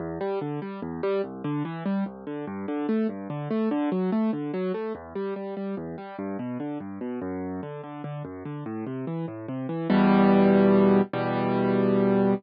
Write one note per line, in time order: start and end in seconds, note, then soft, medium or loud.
0.00 0.19 E2 medium
0.21 0.39 G3 medium
0.41 0.60 D3 medium
0.62 0.80 G3 medium
0.82 1.01 E2 medium
1.03 1.22 G3 medium
1.24 1.42 C2 medium
1.44 1.63 D3 medium
1.65 1.84 E3 medium
1.86 2.04 G3 medium
2.06 2.25 C2 medium
2.27 2.45 D3 medium
2.47 2.66 G2 medium
2.68 2.87 D3 medium
2.89 3.07 A3 medium
3.09 3.28 G2 medium
3.30 3.48 D3 medium
3.51 3.69 A3 medium
3.71 3.90 D3 medium
3.92 4.10 F#3 medium
4.12 4.31 A3 medium
4.33 4.52 D3 medium
4.54 4.72 F#3 medium
4.74 4.93 A3 medium
4.95 5.13 E2 medium
5.15 5.34 G3 medium
5.36 5.55 G3 medium
5.57 5.75 G3 medium
5.77 5.96 E2 medium
5.98 6.16 G3 medium
6.19 6.37 G2 medium
6.39 6.58 B2 medium
6.60 6.78 D3 medium
6.80 6.99 G2 medium
7.01 7.20 B2 medium
7.22 7.61 F#2 medium
7.63 7.81 D3 medium
7.84 8.02 D3 medium
8.04 8.23 D3 medium
8.25 8.43 F#2 medium
8.45 8.64 D3 medium
8.66 8.85 A2 medium
8.87 9.05 C3 medium
9.07 9.26 E3 medium
9.28 9.46 A2 medium
9.48 9.67 C3 medium
9.69 9.88 E3 medium
9.90 11.01 E2 loud
9.90 11.01 B2 loud
9.90 11.01 G3 loud
11.13 12.34 E2 medium
11.13 12.34 B2 medium
11.13 12.34 G3 loud